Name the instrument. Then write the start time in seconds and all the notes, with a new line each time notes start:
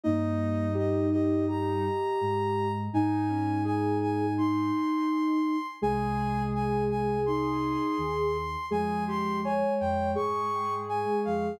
ocarina
0.04 G2 G3 A#3 D#4 D#5
0.74 G4 D#5
1.12 G4 D#5
1.48 G4 A#5
2.21 G#2 G#3
2.93 G#2 G#3 D#4 G#5
3.29 C#4
3.65 G#4 G#5
4.01 G#5
4.38 D#4 C6
5.82 C2 C3 G#3 G#4 G#5
6.55 G#5
6.90 G#5
7.26 D#4 C6
7.98 D#2 D#3
8.70 F2 F3 G#3 G#4 G#5
9.08 G4 C6
9.44 C#5 G#5
9.80 F2 F3 G5
10.15 G#2 G#3 G#4 C#6
10.89 G#5
11.25 F2 F3 F5